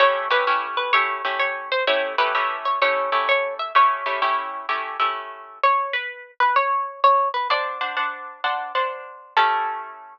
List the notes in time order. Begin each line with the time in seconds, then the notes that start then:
0.00 A3 C#4 E4 G4 C#5
0.30 A3 C#4 E4 G4 B4
0.47 A3 C#4 E4 G4
0.77 B4
0.93 A3 C#4 E4 G4 C#5
1.25 A3 C#4 E4 G4
1.39 C#5
1.72 C5
1.87 A3 C#4 E4 G4 C#5
2.18 A3 C#4 E4 G4 B4
2.35 A3 C#4 E4 G4
2.65 C#5
2.82 A3 C#4 E4 G4 C#5
3.12 A3 C#4 E4 G4
3.29 C#5
3.59 E5
3.75 A3 C#4 E4 G4 C#5
4.06 A3 C#4 E4 G4
4.22 A3 C#4 E4 G4
4.69 A3 C#4 E4 G4
5.00 A3 C#4 E4 G4
5.63 C#5
5.93 B4
6.40 B4
6.56 C#5
7.04 C#5
7.34 B4
7.50 D4 C5 D5 F#5 A5
7.81 D4 C5 F#5 A5
7.97 D4 C5 F#5 A5
8.44 D4 C5 F#5 A5
8.75 D4 C5 F#5 A5
9.37 A3 C#4 E4 G4 A4